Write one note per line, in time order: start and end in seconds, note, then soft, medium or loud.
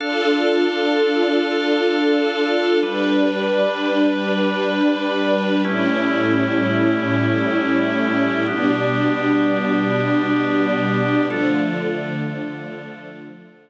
0.00 2.79 D4 medium
0.00 2.80 D4 medium
0.00 2.79 F4 medium
0.00 2.79 A4 loud
0.00 2.80 A4 medium
0.00 2.80 F5 medium
2.83 5.62 G3 loud
2.83 5.62 G3 medium
2.83 5.62 D4 medium
2.83 5.62 B4 loud
2.83 5.62 B4 medium
5.65 8.45 A2 medium
5.65 8.45 G3 medium
5.65 8.44 A3 medium
5.65 8.44 C#4 medium
5.65 8.45 C#4 medium
5.65 8.44 E4 medium
5.65 8.45 E4 medium
5.65 8.44 G4 medium
8.46 11.27 B2 medium
8.46 11.27 G3 medium
8.46 11.26 B3 medium
8.46 11.26 D4 medium
8.46 11.27 D4 medium
8.46 11.26 G4 medium
11.28 13.70 D3 loud
11.28 13.70 F3 medium
11.28 13.70 A3 loud
11.28 13.70 D4 medium
11.28 13.70 F4 medium
11.28 13.70 A4 medium